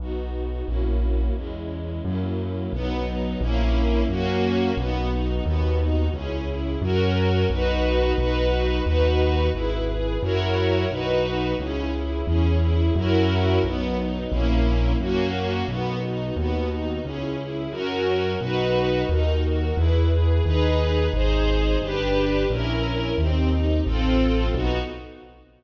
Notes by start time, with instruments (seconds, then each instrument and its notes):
0.00 acoustic grand piano B1, string ensemble 1 B3 D#4 F#4
0.67 acoustic grand piano A#1, string ensemble 1 A#3 C#4 E4 F#4
1.36 acoustic grand piano E2, string ensemble 1 G#3 C#4 E4
2.05 acoustic grand piano F#2, string ensemble 1 F#3 A#3 C#4 E4
2.73 acoustic grand piano B1, string ensemble 1 F#3 B3 D#4
3.05 string ensemble 1 D#4
3.41 acoustic grand piano A#1, string ensemble 1 A#3 C#4 E4
4.09 acoustic grand piano F#2, string ensemble 1 A#3 C#4 F#4
4.77 acoustic grand piano B1, string ensemble 1 B3 D#4 F#4
5.11 string ensemble 1 D#4
5.45 acoustic grand piano D#2, string ensemble 1 B3 D#4 F#4
5.79 string ensemble 1 D#4
6.13 acoustic grand piano C#2, string ensemble 1 C#4 E4 G#4
6.47 string ensemble 1 E4
6.82 acoustic grand piano F#2, string ensemble 1 C#4 F#4 A#4
7.50 acoustic grand piano B1, string ensemble 1 D#4 F#4 B4
8.18 acoustic grand piano B1, string ensemble 1 D#4 F#4 B4
8.85 acoustic grand piano D#2, string ensemble 1 D#4 F#4 B4
9.54 acoustic grand piano G#1, string ensemble 1 E4 G#4 B4
9.88 string ensemble 1 G#4
10.22 acoustic grand piano F#2, string ensemble 1 E4 F#4 A#4 C#5
10.90 acoustic grand piano B1, string ensemble 1 D#4 F#4 B4
11.58 acoustic grand piano C#2, string ensemble 1 C#4 E4 G#4
11.94 string ensemble 1 E4
12.27 acoustic grand piano E2, string ensemble 1 C#4 E4 G#4
12.61 string ensemble 1 E4
12.95 acoustic grand piano F#2, string ensemble 1 C#4 E4 F#4 A#4
13.64 acoustic grand piano B1, string ensemble 1 F#3 B3 D#4
13.99 string ensemble 1 D#4
14.31 acoustic grand piano A#1, string ensemble 1 A#3 C#4 E4
14.99 acoustic grand piano F#2, string ensemble 1 A#3 C#4 F#4
15.68 acoustic grand piano B1, string ensemble 1 B3 D#4 F#4
16.03 string ensemble 1 D#4
16.36 acoustic grand piano D#2, string ensemble 1 B3 D#4 F#4
16.70 string ensemble 1 D#4
17.04 acoustic grand piano C#2, string ensemble 1 C#4 E4 G#4
17.39 string ensemble 1 E4
17.71 acoustic grand piano F#2, string ensemble 1 C#4 F#4 A#4
18.40 acoustic grand piano B1, string ensemble 1 D#4 F#4 B4
19.09 acoustic grand piano D#2, string ensemble 1 D#4 F#4 A#4
19.45 string ensemble 1 F#4
19.77 acoustic grand piano E2, string ensemble 1 E4 G#4 B4
20.12 string ensemble 1 G#4
20.45 acoustic grand piano D#2, string ensemble 1 D#4 G#4 B4
21.14 acoustic grand piano G#1, string ensemble 1 D#4 G#4 C5
21.82 acoustic grand piano G1, string ensemble 1 D4 G4 B4
22.49 acoustic grand piano A#1, string ensemble 1 C#4 E4 A#4
23.18 acoustic grand piano D#2, string ensemble 1 C4 D#4 G4
23.51 string ensemble 1 D#4
23.86 acoustic grand piano A1, string ensemble 1 C4 F4 A4
24.55 acoustic grand piano B1, string ensemble 1 B3 D#4 F#4